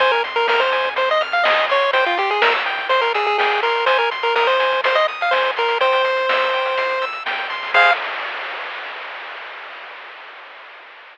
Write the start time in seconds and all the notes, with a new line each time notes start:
0.00 F2 C5 G#5, kick, closed hi-hat
0.12 A#4, closed hi-hat
0.24 C6, closed hi-hat
0.36 A#4, closed hi-hat
0.48 A#4 F6, snare
0.60 C5, closed hi-hat
0.72 G#5, closed hi-hat
0.84 kick, closed hi-hat
0.96 C5 C6, kick, closed hi-hat
1.09 D#5, closed hi-hat
1.21 F6, closed hi-hat
1.32 F5, closed hi-hat
1.44 D#5 G#5, snare
1.57 closed hi-hat
1.69 C#5 C6, closed hi-hat
1.81 closed hi-hat
1.93 C2 C5 G5, kick, closed hi-hat
2.06 F4, closed hi-hat
2.18 G4 C6, kick, closed hi-hat
2.30 G#4, closed hi-hat
2.42 A#4 E6, snare
2.54 closed hi-hat
2.66 G5, closed hi-hat
2.78 kick, closed hi-hat
2.89 C5 C6, kick, closed hi-hat
3.02 A#4, closed hi-hat
3.14 G#4 E6, closed hi-hat
3.26 G#4, closed hi-hat
3.38 G#4 G5, snare
3.52 closed hi-hat
3.63 A#4 C6, closed hi-hat
3.75 closed hi-hat
3.86 G#1 C5 G#5, kick, closed hi-hat
3.99 A#4, closed hi-hat
4.11 C6, closed hi-hat
4.23 A#4, closed hi-hat
4.35 A#4 D#6, snare
4.47 C5, closed hi-hat
4.60 G#5, closed hi-hat
4.72 kick, closed hi-hat
4.84 C5 C6, kick, closed hi-hat
4.95 D#5, closed hi-hat
5.08 D#6, closed hi-hat
5.21 F5, closed hi-hat
5.31 C5 G#5, snare
5.44 closed hi-hat
5.56 C2 A#4 C6, closed hi-hat
5.68 closed hi-hat
5.81 C5 G5, kick, closed hi-hat
5.93 closed hi-hat
6.04 C6, kick, closed hi-hat
6.17 closed hi-hat
6.29 E6, snare
6.41 closed hi-hat
6.53 G5, closed hi-hat
6.65 closed hi-hat
6.77 C6, kick, closed hi-hat
6.90 closed hi-hat
7.02 E6, closed hi-hat
7.13 closed hi-hat
7.25 D#2 G5, snare
7.38 closed hi-hat
7.50 E2 C6, closed hi-hat
7.63 open hi-hat
7.74 F2 G#4 C5 F5, kick, crash